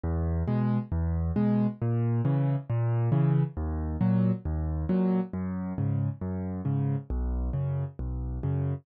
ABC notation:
X:1
M:4/4
L:1/8
Q:1/4=136
K:G#m
V:1 name="Acoustic Grand Piano" clef=bass
E,,2 [B,,G,]2 E,,2 [B,,G,]2 | A,,2 [C,E,]2 A,,2 [C,E,]2 | D,,2 [A,,F,]2 D,,2 [A,,F,]2 | F,,2 [G,,C,]2 F,,2 [G,,C,]2 |
B,,,2 [F,,C,]2 B,,,2 [F,,C,]2 |]